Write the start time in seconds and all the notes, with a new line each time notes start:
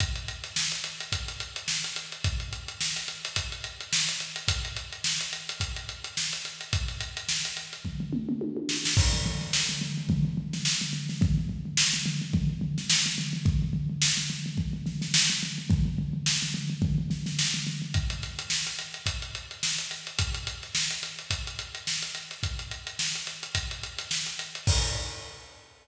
0.00 kick, closed hi-hat
0.16 closed hi-hat
0.28 closed hi-hat
0.44 snare, closed hi-hat
0.56 snare
0.71 snare, closed hi-hat
0.84 closed hi-hat
1.00 closed hi-hat
1.12 kick, closed hi-hat
1.28 snare, closed hi-hat
1.40 closed hi-hat
1.56 closed hi-hat
1.68 snare
1.84 closed hi-hat
1.96 closed hi-hat
2.12 closed hi-hat
2.24 kick, closed hi-hat
2.40 closed hi-hat
2.53 closed hi-hat
2.68 closed hi-hat
2.81 snare
2.96 snare, closed hi-hat
3.08 closed hi-hat
3.24 snare, closed hi-hat
3.36 kick, closed hi-hat
3.52 closed hi-hat
3.64 closed hi-hat
3.80 closed hi-hat
3.93 snare
4.09 closed hi-hat
4.20 closed hi-hat
4.36 closed hi-hat
4.48 kick, closed hi-hat
4.65 closed hi-hat
4.76 closed hi-hat
4.92 closed hi-hat
5.04 snare
5.21 closed hi-hat
5.33 closed hi-hat
5.49 closed hi-hat
5.60 kick, closed hi-hat
5.76 closed hi-hat
5.89 closed hi-hat
6.04 closed hi-hat
6.17 snare
6.33 closed hi-hat
6.45 snare, closed hi-hat
6.61 closed hi-hat
6.73 kick, closed hi-hat
6.88 snare, closed hi-hat
7.00 closed hi-hat
7.17 closed hi-hat
7.29 snare
7.45 snare, closed hi-hat
7.57 closed hi-hat
7.73 closed hi-hat
7.85 kick, floor tom
8.00 floor tom
8.13 mid tom
8.29 mid tom
8.41 high tom
8.57 high tom
8.69 snare
8.85 snare
8.97 kick, crash
9.13 floor tom
9.25 floor tom
9.41 snare, floor tom
9.53 snare
9.69 floor tom
9.81 floor tom
9.97 floor tom
10.09 kick, floor tom
10.25 floor tom
10.37 floor tom
10.53 snare, floor tom
10.65 snare
10.81 floor tom
10.93 floor tom
11.09 snare, floor tom
11.21 kick, floor tom
11.38 floor tom
11.49 floor tom
11.65 floor tom
11.77 snare
11.93 floor tom
12.06 floor tom
12.21 floor tom
12.33 kick, floor tom
12.50 floor tom
12.61 floor tom
12.78 snare, floor tom
12.90 snare
13.06 floor tom
13.18 snare, floor tom
13.33 floor tom
13.45 kick, floor tom
13.62 floor tom
13.73 floor tom
13.90 floor tom
14.02 snare
14.17 floor tom
14.30 floor tom
14.46 floor tom
14.57 kick, floor tom
14.73 floor tom
14.86 snare, floor tom
15.02 snare, floor tom
15.14 snare
15.30 floor tom
15.42 snare, floor tom
15.58 floor tom
15.70 kick, floor tom
15.85 floor tom
15.98 floor tom
16.13 floor tom
16.26 snare
16.42 floor tom
16.54 floor tom
16.70 floor tom
16.82 kick, floor tom
16.98 floor tom
17.10 snare, floor tom
17.26 snare, floor tom
17.39 snare
17.54 floor tom
17.66 snare, floor tom
17.82 floor tom
17.94 kick, closed hi-hat
18.10 closed hi-hat
18.22 snare, closed hi-hat
18.39 closed hi-hat
18.50 snare
18.67 closed hi-hat
18.79 closed hi-hat
18.94 closed hi-hat
19.06 kick, closed hi-hat
19.22 closed hi-hat
19.35 closed hi-hat
19.51 closed hi-hat
19.63 snare
19.78 closed hi-hat
19.91 closed hi-hat
20.07 closed hi-hat
20.19 kick, closed hi-hat
20.34 closed hi-hat
20.47 closed hi-hat
20.63 snare, closed hi-hat
20.75 snare
20.91 closed hi-hat
21.03 closed hi-hat
21.19 closed hi-hat
21.30 kick, closed hi-hat
21.47 closed hi-hat
21.59 closed hi-hat
21.75 closed hi-hat
21.87 snare
22.02 closed hi-hat
22.15 closed hi-hat
22.31 snare, closed hi-hat
22.43 kick, closed hi-hat
22.59 closed hi-hat
22.71 closed hi-hat
22.87 closed hi-hat
22.99 snare
23.15 closed hi-hat
23.27 closed hi-hat
23.43 closed hi-hat
23.55 kick, closed hi-hat
23.71 closed hi-hat
23.83 closed hi-hat
23.98 snare, closed hi-hat
24.11 snare
24.26 closed hi-hat
24.39 closed hi-hat
24.55 closed hi-hat
24.67 kick, crash